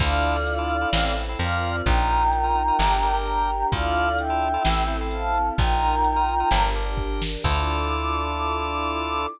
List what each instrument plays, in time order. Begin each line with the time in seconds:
0.00 electric bass (finger) D2, drawbar organ D4 E4 F4 A4, string ensemble 1 D4 E4 F4 A4, choir aahs D5 F5, kick, crash
0.23 closed hi-hat
0.47 closed hi-hat
0.58 drawbar organ D4 E4 F4 A4
0.70 closed hi-hat
0.81 drawbar organ D4 E4 F4 A4
0.93 electric bass (finger) A1, string ensemble 1 C4 E4 A4, drawbar organ C4 E4 A4, snare
1.16 drawbar organ C4 E4 A4, closed hi-hat
1.29 drawbar organ C4 E4 A4
1.39 electric bass (finger) F2, drawbar organ C4 F4 A#4, string ensemble 1 C4 F4 A#4, choir aahs D5 F5, closed hi-hat
1.63 closed hi-hat
1.85 electric bass (finger) A#1, drawbar organ D#4 F4 A#4, string ensemble 1 D#4 F4 A#4, choir aahs G5 A#5, kick, closed hi-hat
2.09 closed hi-hat
2.33 closed hi-hat
2.44 drawbar organ D#4 F4 A#4
2.55 closed hi-hat
2.68 drawbar organ D#4 F4 A#4
2.79 electric bass (finger) G1, drawbar organ D4 G4 A#4, string ensemble 1 D4 G4 A#4, snare
3.03 drawbar organ D4 G4 A#4, closed hi-hat
3.13 drawbar organ D4 G4 A#4
3.25 choir aahs G5 A#5, closed hi-hat
3.49 closed hi-hat
3.72 electric bass (finger) D2, drawbar organ D4 E4 F4 A4, string ensemble 1 D4 E4 F4 A4, choir aahs D5 F5, kick, closed hi-hat
3.96 closed hi-hat
4.18 choir aahs E5 G5, closed hi-hat
4.30 drawbar organ D4 E4 F4 A4
4.42 closed hi-hat
4.54 drawbar organ D4 E4 F4 A4
4.64 electric bass (finger) A1, string ensemble 1 C4 E4 A4, drawbar organ C4 E4 A4, snare
4.87 drawbar organ C4 E4 A4, closed hi-hat
5.01 drawbar organ C4 E4 A4
5.11 choir aahs F5 A5, closed hi-hat
5.35 closed hi-hat
5.58 electric bass (finger) A#1, drawbar organ D#4 F4 A#4, string ensemble 1 D#4 F4 A#4, choir aahs G5 A#5, kick, closed hi-hat
5.81 closed hi-hat
6.04 closed hi-hat
6.16 drawbar organ D#4 F4 A#4
6.29 closed hi-hat
6.40 drawbar organ D#4 F4 A#4
6.51 electric bass (finger) G1, drawbar organ D4 G4 A#4, string ensemble 1 D4 G4 A#4, snare
6.74 drawbar organ D4 G4 A#4, closed hi-hat
6.85 drawbar organ D4 G4 A#4
6.97 kick
7.22 snare
7.44 electric bass (finger) D2, drawbar organ D4 E4 F4 A4, string ensemble 1 D4 E4 F4 A4, choir aahs D6, kick, crash